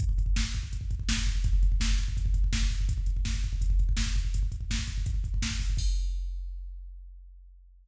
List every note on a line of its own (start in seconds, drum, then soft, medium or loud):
0.00 kick loud
0.00 closed hi-hat loud
0.09 kick medium
0.18 kick medium
0.18 closed hi-hat medium
0.26 kick medium
0.36 kick loud
0.36 snare loud
0.45 kick medium
0.54 kick medium
0.54 closed hi-hat medium
0.63 kick medium
0.73 kick medium
0.73 closed hi-hat loud
0.81 kick medium
0.91 kick loud
0.91 closed hi-hat medium
0.99 kick medium
1.09 kick medium
1.09 snare loud
1.17 kick medium
1.27 kick medium
1.27 closed hi-hat medium
1.36 kick medium
1.44 kick loud
1.44 closed hi-hat loud
1.53 kick medium
1.63 kick medium
1.63 closed hi-hat medium
1.72 kick medium
1.80 kick medium
1.80 snare loud
1.90 kick medium
1.98 kick medium
1.98 closed hi-hat medium
2.08 kick medium
2.17 kick loud
2.17 closed hi-hat loud
2.26 kick loud
2.34 kick loud
2.34 closed hi-hat medium
2.44 kick medium
2.53 kick loud
2.53 snare loud
2.62 kick medium
2.71 kick medium
2.71 closed hi-hat medium
2.81 kick medium
2.89 kick loud
2.89 closed hi-hat loud
2.98 kick medium
3.06 kick medium
3.06 closed hi-hat medium
3.17 kick medium
3.25 kick loud
3.25 snare loud
3.34 kick medium
3.44 kick medium
3.44 closed hi-hat medium
3.53 kick medium
3.61 kick medium
3.61 closed hi-hat loud
3.70 kick medium
3.79 kick medium
3.79 closed hi-hat medium
3.89 kick loud
3.97 kick medium
3.97 snare loud
4.06 kick medium
4.15 kick medium
4.15 closed hi-hat medium
4.25 kick medium
4.34 kick loud
4.34 closed hi-hat loud
4.43 kick medium
4.52 kick medium
4.52 closed hi-hat medium
4.61 kick medium
4.70 kick medium
4.70 snare loud
4.79 kick medium
4.87 kick medium
4.87 closed hi-hat medium
4.98 kick medium
5.06 kick loud
5.06 closed hi-hat loud
5.14 kick medium
5.24 kick medium
5.24 closed hi-hat medium
5.34 kick medium
5.42 kick medium
5.42 snare loud
5.51 kick medium
5.60 kick medium
5.60 open hi-hat medium
5.70 kick medium
5.77 kick loud
5.77 crash loud